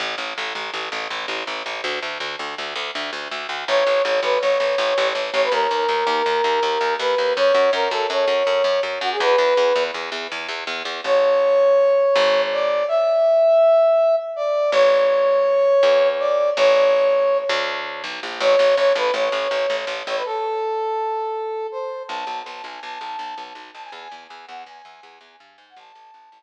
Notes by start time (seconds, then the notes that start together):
0.00 A1
0.18 A1
0.38 A1
0.55 A1
0.74 A1
0.92 A1
1.10 A1
1.28 A1
1.47 A1
1.66 A1
1.84 D2
2.03 D2
2.20 D2
2.39 D2
2.58 D2
2.76 D2
2.95 D2
3.13 D2
3.31 D2
3.49 D2
3.68 A1 C#5
3.87 A1
4.03 A1 C#5
4.22 A1 B4
4.40 A1 C#5
4.60 A1
4.78 A1
4.98 A1
5.15 A1
5.33 A1 C#5
5.43 B4
5.52 D#2 A#4
5.71 D#2
5.89 D#2
6.07 D#2
6.26 D#2
6.44 D#2
6.63 D#2
6.81 D#2
6.99 D#2 B4
7.18 D#2
7.36 F#2 C#5
7.54 F#2
7.73 F#2 A#4
7.91 F#2 A4
8.10 F#2 C#5
8.28 F#2
8.47 F#2
8.64 F#2
8.83 F#2
9.01 F#2 F#4
9.12 G#4
9.20 E2 B4
9.38 E2
9.57 E2
9.76 E2
9.94 E2
10.12 E2
10.32 E2
10.48 E2
10.67 E2
10.85 E2
11.04 A1 C#5
12.16 G#1
12.52 D5
12.88 E5
14.36 D5
14.72 A1 C#5
15.83 E2
16.19 D5
16.56 A1 C#5
17.49 D2
18.04 B1
18.23 A#1
18.40 A1 C#5
18.59 A1
18.77 A1 C#5
18.95 A1 B4
19.14 A1 C#5
19.32 A1
19.51 A1
19.70 A1
19.87 A1
20.07 A1 C#5
20.16 B4
20.25 A4
21.71 C5
22.08 B1 A5
22.27 B1
22.45 B1 A5
22.64 B1 G#5
22.83 B1 A5
23.01 B1
23.19 B1
23.37 B1
23.55 B1
23.74 B1 A5
23.84 G#5
23.92 E2 G#5
24.12 E2
24.28 E2 G#5
24.47 E2 F#5
24.66 E2 G#5
24.85 E2
25.03 E2
25.21 E2
25.40 G2
25.57 G#2 G#5
25.69 F#5
25.76 A1 A5
25.95 A1
26.14 A1
26.32 A1